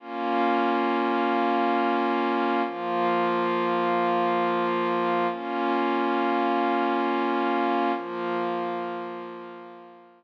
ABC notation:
X:1
M:3/4
L:1/8
Q:1/4=68
K:Bbdor
V:1 name="Pad 5 (bowed)"
[B,DF]6 | [F,B,F]6 | [B,DF]6 | [F,B,F]6 |]